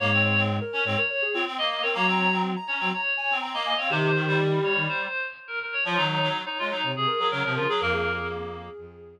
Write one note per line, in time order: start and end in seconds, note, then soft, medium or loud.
0.00 0.60 G#2 loud
0.00 0.10 A#3 medium
0.00 0.22 C#5 loud
0.00 0.40 C#5 loud
0.13 0.36 C4 medium
0.24 0.59 C#5 medium
0.37 0.57 C4 medium
0.61 0.82 A#4 loud
0.73 0.84 C#4 medium
0.73 0.94 C#5 medium
0.85 0.96 G#2 loud
0.85 0.98 C4 medium
0.85 0.97 C#5 loud
0.96 1.09 A#4 medium
0.96 1.42 C#5 medium
1.10 1.21 C#5 medium
1.22 1.34 G#4 loud
1.33 1.45 C4 medium
1.33 1.46 F4 medium
1.46 1.58 C4 medium
1.58 1.83 A#3 medium
1.58 1.69 D#5 medium
1.71 1.82 D#5 medium
1.82 1.95 C4 medium
1.82 1.95 A#4 medium
1.82 1.94 C#5 medium
1.93 2.56 F#3 loud
1.93 2.05 A#3 medium
1.93 2.35 C#5 medium
1.93 2.42 A#5 loud
2.07 2.26 C4 medium
2.32 2.53 C4 medium
2.56 3.01 A#5 medium
2.67 2.80 C#4 medium
2.67 2.88 C#5 medium
2.80 2.92 F#3 medium
2.80 2.91 C4 medium
2.93 3.38 C#5 medium
3.17 3.29 G#5 medium
3.29 3.41 C4 medium
3.29 3.41 G#5 medium
3.41 3.53 C4 medium
3.41 3.53 A#5 medium
3.54 3.74 A#3 medium
3.54 3.66 D#5 medium
3.54 3.65 A#5 loud
3.66 3.79 D#5 medium
3.66 3.77 G#5 medium
3.77 3.90 C4 medium
3.77 3.89 C#5 medium
3.77 3.90 F5 medium
3.90 4.10 C3 medium
3.90 4.60 D#3 loud
3.90 4.73 G4 loud
3.90 4.38 C5 medium
4.15 4.26 D#3 medium
4.27 5.07 G3 medium
4.64 4.88 C#5 medium
4.76 4.87 D#3 medium
4.88 5.28 C5 medium
5.48 5.59 A#4 medium
5.63 5.74 A#4 medium
5.73 5.84 C#5 medium
5.85 5.96 F3 medium
5.85 5.98 F3 loud
5.85 5.98 F4 loud
5.85 6.31 C#5 loud
5.96 6.29 D#3 medium
5.96 6.19 F#3 medium
5.96 6.37 D#4 medium
6.22 6.42 F#3 medium
6.46 6.58 D#4 medium
6.46 6.91 C#5 medium
6.59 6.71 G#3 medium
6.59 6.70 F4 medium
6.70 6.82 F#3 medium
6.70 6.92 D#4 medium
6.83 6.95 C3 medium
6.95 7.07 C3 medium
6.95 7.28 G#4 medium
7.07 7.19 A#4 loud
7.19 7.31 F#3 medium
7.19 7.31 A#4 medium
7.31 7.43 C#3 medium
7.31 7.43 F#3 medium
7.31 7.43 A#4 medium
7.31 7.43 C#5 medium
7.44 7.57 C3 loud
7.44 7.65 F3 medium
7.44 7.56 A#4 medium
7.44 7.55 C#5 medium
7.56 7.67 C#3 medium
7.56 7.68 F4 medium
7.56 7.68 A#4 medium
7.68 7.81 F#3 medium
7.68 7.80 G#4 medium
7.68 7.81 G#4 medium
7.80 8.70 F2 medium
7.80 8.68 A#3 medium
7.80 7.92 A#4 loud
7.80 8.26 A#4 loud
7.93 8.14 G#4 loud
8.17 9.16 G#4 loud
8.78 9.19 F2 medium